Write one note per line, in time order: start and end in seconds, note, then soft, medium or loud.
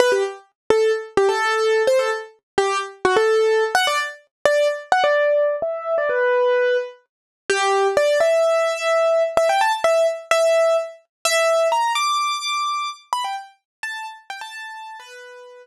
0.00 0.11 B4 loud
0.12 0.23 G4 medium
0.70 0.92 A4 medium
1.17 1.28 G4 medium
1.29 1.82 A4 medium
1.87 1.99 C5 medium
1.99 2.10 A4 medium
2.58 2.78 G4 medium
3.05 3.16 F#4 medium
3.17 3.64 A4 medium
3.75 3.86 F#5 loud
3.87 3.98 D5 medium
4.45 4.68 D5 medium
4.92 5.03 F#5 medium
5.04 5.56 D5 medium
5.62 5.95 E5 medium
5.98 6.09 D5 medium
6.09 6.77 B4 medium
7.50 7.88 G4 medium
7.97 8.18 D5 medium
8.20 9.23 E5 medium
9.37 9.48 E5 medium
9.49 9.60 G5 medium
9.61 9.72 A5 medium
9.84 10.07 E5 medium
10.31 10.77 E5 medium
11.25 11.68 E5 loud
11.72 11.92 A#5 medium
11.95 12.90 D6 medium
13.13 13.24 B5 medium
13.24 13.36 G5 medium
13.83 14.06 A5 medium
14.30 14.41 G5 medium
14.41 14.97 A5 medium
15.00 15.67 B4 medium